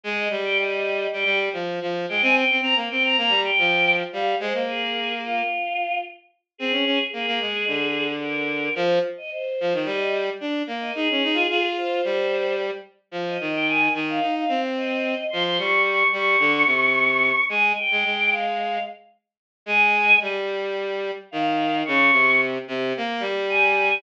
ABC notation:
X:1
M:4/4
L:1/16
Q:1/4=110
K:Fm
V:1 name="Choir Aahs"
e2 z g e4 g2 z5 g | a g2 b z g b b2 g4 z f2 | c2 A4 F6 z4 | A4 A8 B4 |
c2 z e c4 e2 z5 e | A6 c6 z4 | z e2 g a2 z f2 f2 z e4 | c' c' d'2 d'2 d'10 |
a2 g4 f4 z6 | a4 z8 f4 | d'4 z8 a4 |]
V:2 name="Violin"
A,2 G,6 G, G,2 F,2 F,2 A, | C2 C C B, C2 B, G,2 F,4 G,2 | A, B,7 z8 | C D D z B, B, A,2 =D,8 |
F,2 z4 F, E, G,4 =D2 B,2 | E D E F F4 G,6 z2 | F,2 E,4 E,2 E2 C6 | F,2 G,4 G,2 =D,2 C,6 |
A,2 z A, A,6 z6 | A,4 G,8 E,4 | D,2 C,4 C,2 B,2 G,6 |]